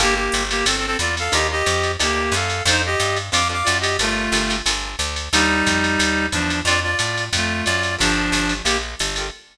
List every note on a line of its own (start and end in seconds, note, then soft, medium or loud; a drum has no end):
0.00 0.29 G1 loud
0.00 0.23 A#3 loud
0.00 0.14 A#3 loud
0.00 0.23 F4 loud
0.00 0.23 G4 loud
0.00 0.14 G4 loud
0.00 0.23 A4 loud
0.00 kick medium
0.00 ride loud
0.15 0.44 A#3 medium
0.15 0.44 G4 medium
0.32 0.63 G1 loud
0.32 hi-hat pedal loud
0.32 ride medium
0.51 0.65 A#3 medium
0.51 0.65 G4 medium
0.51 ride loud
0.66 0.96 G1 medium
0.66 0.77 C4 medium
0.66 0.77 A4 medium
0.66 ride loud
0.77 0.86 C4 medium
0.77 0.86 A4 medium
0.87 0.97 C4 medium
0.87 0.97 A4 medium
0.99 1.29 E2 medium
0.99 1.15 F4 medium
0.99 1.15 D5 medium
0.99 hi-hat pedal medium
0.99 ride medium
1.17 1.34 A4 medium
1.17 1.34 F5 medium
1.17 ride medium
1.32 1.63 D#2 loud
1.32 1.55 D4 loud
1.32 1.55 D#4 medium
1.32 1.55 F4 medium
1.32 1.55 G4 medium
1.32 1.47 G4 medium
1.32 1.47 D#5 loud
1.32 ride loud
1.52 1.92 G4 medium
1.52 1.92 D#5 medium
1.66 1.97 F2 loud
1.66 hi-hat pedal medium
1.66 ride medium
1.83 ride medium
1.99 2.30 D2 medium
1.99 2.34 A#3 medium
1.99 2.23 D4 medium
1.99 2.23 D#4 medium
1.99 2.23 F4 medium
1.99 2.23 G4 medium
1.99 2.34 G4 medium
1.99 ride loud
2.32 2.62 F#2 loud
2.32 2.63 A4 medium
2.32 2.63 F5 medium
2.32 hi-hat pedal loud
2.32 ride medium
2.50 ride medium
2.65 2.95 F2 loud
2.65 2.90 C4 medium
2.65 2.90 D4 loud
2.65 2.82 D#4 medium
2.65 2.90 F4 loud
2.65 2.90 A4 medium
2.65 2.82 C5 loud
2.65 kick medium
2.65 ride loud
2.86 3.18 G4 medium
2.86 3.18 D#5 medium
3.00 3.30 G2 loud
3.00 hi-hat pedal loud
3.00 ride medium
3.16 ride medium
3.32 3.63 F2 medium
3.32 3.44 C4 medium
3.32 3.44 D4 medium
3.32 3.44 F4 medium
3.32 3.44 A4 medium
3.32 3.48 F5 medium
3.32 3.48 D6 medium
3.32 ride loud
3.49 3.73 C4 medium
3.49 3.73 D4 medium
3.49 3.73 F4 medium
3.49 3.73 A4 medium
3.49 3.68 F5 medium
3.49 3.68 D6 medium
3.64 3.97 F#2 loud
3.64 3.78 F4 medium
3.64 3.78 D5 medium
3.64 hi-hat pedal loud
3.64 ride loud
3.81 3.97 G4 medium
3.81 3.97 D#5 medium
3.81 ride loud
3.99 4.29 G1 medium
3.99 4.56 A3 medium
3.99 4.24 F4 medium
3.99 4.56 F4 medium
3.99 4.24 G4 medium
3.99 4.24 A4 medium
3.99 4.24 A#4 loud
3.99 ride loud
4.32 4.62 G1 loud
4.32 4.44 F4 medium
4.32 4.44 G4 medium
4.32 4.44 A4 medium
4.32 4.44 A#4 medium
4.32 hi-hat pedal medium
4.32 ride loud
4.50 4.61 F4 medium
4.50 4.61 G4 medium
4.50 4.61 A4 medium
4.50 4.61 A#4 medium
4.50 ride medium
4.66 4.96 G1 medium
4.66 4.91 F4 medium
4.66 4.91 G4 medium
4.66 4.91 A4 medium
4.66 4.91 A#4 medium
4.66 ride loud
4.99 5.29 D2 loud
4.99 hi-hat pedal loud
4.99 ride medium
5.16 ride medium
5.33 5.63 D#2 loud
5.33 6.26 G3 loud
5.33 5.57 D4 medium
5.33 6.26 D#4 loud
5.33 5.57 D#4 medium
5.33 5.57 F4 medium
5.33 5.57 G4 loud
5.33 ride loud
5.66 5.97 F2 medium
5.66 kick medium
5.66 hi-hat pedal medium
5.66 ride loud
5.84 ride medium
5.99 6.29 D#2 medium
5.99 ride loud
6.32 6.63 E2 medium
6.32 6.61 F3 medium
6.32 6.61 D4 medium
6.32 kick medium
6.32 hi-hat pedal medium
6.32 ride medium
6.50 ride medium
6.65 6.95 F2 loud
6.65 6.91 C4 medium
6.65 6.91 D4 loud
6.65 6.80 F4 medium
6.65 6.91 F4 loud
6.65 6.91 A4 loud
6.65 6.80 D5 loud
6.65 ride loud
6.83 7.25 F4 medium
6.83 7.25 D5 medium
6.99 7.30 A2 medium
6.99 hi-hat pedal loud
6.99 ride loud
7.17 ride medium
7.33 7.63 F2 loud
7.33 7.65 A3 medium
7.33 7.65 F4 medium
7.33 kick medium
7.33 ride loud
7.65 7.97 F#2 loud
7.65 7.95 F4 medium
7.65 7.95 D5 medium
7.65 hi-hat pedal medium
7.65 ride medium
7.83 ride medium
7.98 8.30 G1 loud
7.98 8.54 F3 medium
7.98 8.54 D4 loud
7.98 8.22 F4 loud
7.98 8.22 G4 medium
7.98 8.22 A4 loud
7.98 8.22 A#4 medium
7.98 kick medium
7.98 ride loud
8.32 8.62 G1 loud
8.32 hi-hat pedal medium
8.32 ride loud
8.49 ride medium
8.64 8.95 A#1 medium
8.64 8.77 A#3 medium
8.64 8.77 G4 medium
8.64 ride loud
8.99 9.30 G1 medium
8.99 hi-hat pedal loud
8.99 ride loud
9.16 9.29 F4 medium
9.16 9.29 G4 medium
9.16 9.29 A4 medium
9.16 9.29 A#4 medium
9.16 ride medium